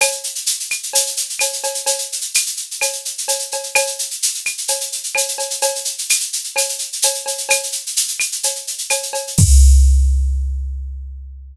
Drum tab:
CC |----------------|----------------|----------------|----------------|
SH |xxxxxxxxxxxxxxxx|xxxxxxxxxxxxxxxx|xxxxxxxxxxxxxxxx|xxxxxxxxxxxxxxxx|
CB |x-------x---x-x-|x-------x---x-x-|x-------x---x-x-|x-------x---x-x-|
CL |x-----x-----x---|----x---x-------|x-----x-----x---|----x---x-------|
BD |----------------|----------------|----------------|----------------|

CC |----------------|x---------------|
SH |xxxxxxxxxxxxxxxx|----------------|
CB |x-------x---x-x-|----------------|
CL |x-----x-----x---|----------------|
BD |----------------|o---------------|